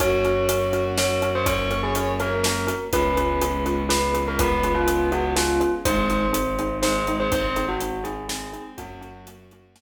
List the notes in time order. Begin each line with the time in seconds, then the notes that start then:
0.00 F#2 A#3 C#4 F#4 A#4 C#5, kick, closed hi-hat
0.24 C#4 F#4 A#4, closed hi-hat
0.49 C#4 F#4 A#4, closed hi-hat
0.73 C#4 F#4 A#4, closed hi-hat
0.98 C#4 F#4 A#4 C#5, snare
1.22 C#4 F#4 A#4, closed hi-hat
1.35 C5
1.46 C#4 F#4 A#4 C#5, kick, closed hi-hat
1.71 C#4 F#4 A#4, closed hi-hat
1.83 G#4
1.95 C#4 F#4 A#4, closed hi-hat
2.20 C#4 F#4 A#4 C#5, closed hi-hat
2.43 C#4 F#4 A#4, snare
2.67 C#4 F#4 A#4, closed hi-hat
2.92 C#2 G#3 B3 C#4 F4 G#4 B4, kick, closed hi-hat
3.17 C#4 F4 G#4 B4, closed hi-hat
3.41 C#4 F4 G#4 B4, closed hi-hat
3.66 C#4 F4 G#4 B4, closed hi-hat
3.89 C#4 F4 G#4 B4, snare
4.14 C#4 F4 G#4 B4, closed hi-hat
4.28 A#4
4.39 B3 C#4 F4 G#4 B4, kick, closed hi-hat
4.63 C#4 F4 G#4 B4, closed hi-hat
4.74 F4
4.87 C#4 F4 G#4 B4, closed hi-hat
5.12 B3 C#4 F4 F#4 G#4 B4, closed hi-hat
5.36 C#4 F4 G#4 B4, snare
5.60 C#4 F4 G#4 B4, closed hi-hat
5.85 G#1 G#3 C4 D#4 G#4 C5, kick, closed hi-hat
6.10 C4 D#4 G#4, closed hi-hat
6.33 C4 D#4 G#4, closed hi-hat
6.59 C4 D#4 G#4, closed hi-hat
6.82 G#3 C4 D#4 G#4 C5, snare
7.07 G#3 C4 D#4 G#4, closed hi-hat
7.20 C5
7.32 C4 D#4 G#4 C5, kick, closed hi-hat
7.56 C4 D#4 G#4, closed hi-hat
7.68 F#4
7.80 C4 D#4 G#4, closed hi-hat
8.04 C4 D#4 G#4, closed hi-hat
8.29 C4 D#4 G#4, snare
8.53 C4 D#4 G#4, closed hi-hat
8.78 F#2 F#3 A#3 C#4 F#4, kick, closed hi-hat
9.01 A#3 C#4 F#4, closed hi-hat
9.27 A#3 C#4 F#4, closed hi-hat
9.51 A#3 C#4 F#4, closed hi-hat
9.76 A#3 C#4 F#4, snare